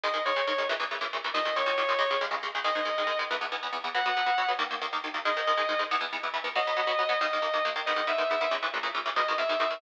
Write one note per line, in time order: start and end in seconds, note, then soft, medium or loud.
0.03 0.08 G#2 medium
0.03 0.08 D#3 loud
0.03 0.08 G#3 medium
0.03 0.22 D#5 loud
0.14 0.18 G#2 medium
0.14 0.18 D#3 medium
0.14 0.18 G#3 medium
0.25 0.30 G#2 medium
0.25 0.30 D#3 medium
0.25 0.30 G#3 medium
0.25 0.43 C#5 loud
0.36 0.40 G#2 medium
0.36 0.40 D#3 medium
0.36 0.40 G#3 medium
0.47 0.52 G#2 medium
0.47 0.52 D#3 medium
0.47 0.52 G#3 medium
0.47 0.65 C#5 medium
0.58 0.63 G#2 medium
0.58 0.63 D#3 medium
0.58 0.63 G#3 medium
0.69 0.74 A#2 loud
0.69 0.74 C#3 loud
0.69 0.74 E3 loud
0.80 0.84 A#2 medium
0.80 0.84 C#3 loud
0.80 0.84 E3 medium
0.91 0.95 A#2 medium
0.91 0.95 C#3 medium
0.91 0.95 E3 medium
1.01 1.05 A#2 medium
1.01 1.05 C#3 medium
1.01 1.05 E3 medium
1.13 1.17 A#2 medium
1.13 1.17 C#3 medium
1.13 1.17 E3 medium
1.24 1.29 A#2 medium
1.24 1.29 C#3 medium
1.24 1.29 E3 medium
1.34 1.39 D#2 loud
1.34 1.39 A#2 loud
1.34 1.39 D#3 medium
1.34 1.55 D#5 loud
1.45 1.50 D#2 medium
1.45 1.50 A#2 medium
1.45 1.50 D#3 medium
1.56 1.61 D#2 medium
1.56 1.61 A#2 medium
1.56 1.61 D#3 medium
1.56 1.76 C#5 medium
1.66 1.71 D#2 loud
1.66 1.71 A#2 medium
1.66 1.71 D#3 medium
1.78 1.82 D#2 medium
1.78 1.82 A#2 medium
1.78 1.82 D#3 medium
1.78 1.98 C#5 medium
1.89 1.93 D#2 medium
1.89 1.93 A#2 medium
1.89 1.93 D#3 medium
1.99 2.03 C#2 medium
1.99 2.03 C#3 loud
1.99 2.03 G#3 loud
1.99 2.17 C#5 loud
2.11 2.15 C#2 medium
2.11 2.15 C#3 medium
2.11 2.15 G#3 medium
2.21 2.25 C#2 loud
2.21 2.25 C#3 medium
2.21 2.25 G#3 loud
2.31 2.35 C#2 medium
2.31 2.35 C#3 medium
2.31 2.35 G#3 medium
2.43 2.47 C#2 medium
2.43 2.47 C#3 medium
2.43 2.47 G#3 medium
2.55 2.59 C#2 medium
2.55 2.59 C#3 medium
2.55 2.59 G#3 medium
2.64 2.69 G#2 loud
2.64 2.69 D#3 loud
2.64 2.69 G#3 loud
2.64 3.17 D#5 loud
2.75 2.80 G#2 medium
2.75 2.80 D#3 medium
2.75 2.80 G#3 medium
2.85 2.90 G#2 medium
2.85 2.90 D#3 medium
2.85 2.90 G#3 medium
2.98 3.02 G#2 medium
2.98 3.02 D#3 medium
2.98 3.02 G#3 medium
3.07 3.11 G#2 medium
3.07 3.11 D#3 medium
3.07 3.11 G#3 medium
3.19 3.23 G#2 medium
3.19 3.23 D#3 medium
3.19 3.23 G#3 medium
3.31 3.35 E2 loud
3.31 3.35 E3 loud
3.31 3.35 B3 medium
3.41 3.45 E2 medium
3.41 3.45 E3 medium
3.41 3.45 B3 medium
3.52 3.56 E2 medium
3.52 3.56 E3 medium
3.52 3.56 B3 medium
3.63 3.67 E2 medium
3.63 3.67 E3 medium
3.63 3.67 B3 medium
3.73 3.77 E2 medium
3.73 3.77 E3 medium
3.73 3.77 B3 medium
3.84 3.88 E2 medium
3.84 3.88 E3 medium
3.84 3.88 B3 medium
3.95 3.99 B2 medium
3.95 3.99 F#3 loud
3.95 3.99 B3 medium
3.95 4.48 F#5 loud
4.06 4.10 B2 medium
4.06 4.10 F#3 medium
4.06 4.10 B3 medium
4.17 4.21 B2 medium
4.17 4.21 F#3 medium
4.17 4.21 B3 medium
4.26 4.31 B2 medium
4.26 4.31 F#3 medium
4.26 4.31 B3 medium
4.38 4.42 B2 medium
4.38 4.42 F#3 medium
4.38 4.42 B3 medium
4.48 4.53 B2 medium
4.48 4.53 F#3 medium
4.48 4.53 B3 medium
4.59 4.63 D#2 loud
4.59 4.63 D#3 loud
4.59 4.63 A#3 loud
4.71 4.75 D#2 medium
4.71 4.75 D#3 medium
4.71 4.75 A#3 medium
4.82 4.86 D#2 medium
4.82 4.86 D#3 medium
4.82 4.86 A#3 medium
4.93 4.97 D#2 medium
4.93 4.97 D#3 medium
4.93 4.97 A#3 medium
5.04 5.08 D#2 medium
5.04 5.08 D#3 medium
5.04 5.08 A#3 medium
5.14 5.18 D#2 medium
5.14 5.18 D#3 medium
5.14 5.18 A#3 medium
5.25 5.30 G#2 loud
5.25 5.30 D#3 loud
5.25 5.30 G#3 loud
5.25 5.80 D#5 loud
5.37 5.41 G#2 medium
5.37 5.41 D#3 medium
5.37 5.41 G#3 medium
5.47 5.52 G#2 medium
5.47 5.52 D#3 medium
5.47 5.52 G#3 medium
5.57 5.62 G#2 medium
5.57 5.62 D#3 medium
5.57 5.62 G#3 medium
5.69 5.73 G#2 medium
5.69 5.73 D#3 medium
5.69 5.73 G#3 medium
5.79 5.83 G#2 medium
5.79 5.83 D#3 medium
5.79 5.83 G#3 medium
5.91 5.95 E2 loud
5.91 5.95 E3 loud
5.91 5.95 B3 loud
6.01 6.05 E2 medium
6.01 6.05 E3 loud
6.01 6.05 B3 medium
6.13 6.17 E2 medium
6.13 6.17 E3 medium
6.13 6.17 B3 medium
6.23 6.28 E2 medium
6.23 6.28 E3 medium
6.23 6.28 B3 medium
6.34 6.38 E2 medium
6.34 6.38 E3 medium
6.34 6.38 B3 medium
6.44 6.48 E2 medium
6.44 6.48 E3 medium
6.44 6.48 B3 medium
6.55 6.60 B2 loud
6.55 6.60 F#3 loud
6.55 6.60 B3 loud
6.55 7.19 D#5 loud
6.67 6.72 B2 medium
6.67 6.72 F#3 medium
6.67 6.72 B3 medium
6.77 6.81 B2 medium
6.77 6.81 F#3 medium
6.77 6.81 B3 medium
6.87 6.91 B2 medium
6.87 6.91 F#3 medium
6.87 6.91 B3 medium
6.99 7.03 B2 medium
6.99 7.03 F#3 medium
6.99 7.03 B3 medium
7.09 7.13 B2 medium
7.09 7.13 F#3 medium
7.09 7.13 B3 loud
7.21 7.25 D#2 loud
7.21 7.25 D#3 loud
7.21 7.25 A#3 loud
7.21 7.67 D#5 loud
7.33 7.37 D#2 medium
7.33 7.37 D#3 medium
7.33 7.37 A#3 medium
7.42 7.46 D#2 medium
7.42 7.46 D#3 medium
7.42 7.46 A#3 medium
7.54 7.58 D#2 medium
7.54 7.58 D#3 medium
7.54 7.58 A#3 medium
7.65 7.69 D#2 loud
7.65 7.69 D#3 medium
7.65 7.69 A#3 medium
7.76 7.80 D#2 loud
7.76 7.80 D#3 medium
7.76 7.80 A#3 medium
7.86 7.91 G#2 loud
7.86 7.91 D#3 loud
7.86 7.91 B3 loud
7.86 8.05 D#5 loud
7.96 8.01 G#2 medium
7.96 8.01 D#3 medium
7.96 8.01 B3 medium
8.07 8.12 G#2 medium
8.07 8.12 D#3 medium
8.07 8.12 B3 medium
8.07 8.28 E5 medium
8.18 8.23 G#2 medium
8.18 8.23 D#3 medium
8.18 8.23 B3 medium
8.30 8.35 G#2 medium
8.30 8.35 D#3 medium
8.30 8.35 B3 medium
8.30 8.50 E5 medium
8.41 8.45 G#2 medium
8.41 8.45 D#3 loud
8.41 8.45 B3 medium
8.51 8.56 A#2 loud
8.51 8.56 C#3 loud
8.51 8.56 E3 medium
8.63 8.67 A#2 medium
8.63 8.67 C#3 medium
8.63 8.67 E3 medium
8.74 8.78 A#2 medium
8.74 8.78 C#3 medium
8.74 8.78 E3 medium
8.83 8.87 A#2 loud
8.83 8.87 C#3 medium
8.83 8.87 E3 medium
8.95 8.99 A#2 medium
8.95 8.99 C#3 medium
8.95 8.99 E3 medium
9.06 9.10 A#2 medium
9.06 9.10 C#3 medium
9.06 9.10 E3 medium
9.16 9.21 G#2 loud
9.16 9.21 B2 loud
9.16 9.21 D#3 loud
9.16 9.35 D#5 loud
9.28 9.33 G#2 medium
9.28 9.33 B2 medium
9.28 9.33 D#3 medium
9.38 9.42 G#2 medium
9.38 9.42 B2 medium
9.38 9.42 D#3 medium
9.38 9.57 E5 medium
9.49 9.54 G#2 medium
9.49 9.54 B2 medium
9.49 9.54 D#3 medium
9.60 9.64 G#2 medium
9.60 9.64 B2 medium
9.60 9.64 D#3 medium
9.60 9.79 E5 loud
9.70 9.75 G#2 medium
9.70 9.75 B2 medium
9.70 9.75 D#3 loud